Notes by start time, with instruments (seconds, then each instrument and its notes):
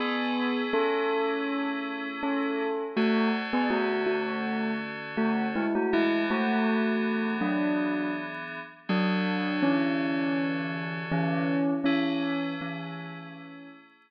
0.00 electric piano 2 A3 C#4 E4 G#4, tubular bells B3 G#4
0.73 tubular bells C#4 A4
2.23 tubular bells C#4 A4
2.96 electric piano 2 D3 C#4 F#4 A4, tubular bells A3 F#4
3.53 tubular bells B3 G#4
3.70 tubular bells A3 F#4
4.06 tubular bells A3 F#4
5.17 tubular bells A3 F#4
5.56 tubular bells G#3 E4
5.75 tubular bells A3 F#4
5.93 electric piano 2 E3 B3 D4 G#4, tubular bells G#3 E4
6.30 tubular bells A3 F#4
7.41 tubular bells F#3 D4
8.89 electric piano 2 D3 C#4 F#4 A4, tubular bells F#3 D4
9.62 tubular bells E3 C#4
11.12 tubular bells E3 C#4
11.84 tubular bells E3 C#4, electric piano 2 A3 C#4 E4 G#4
12.61 tubular bells E3 C#4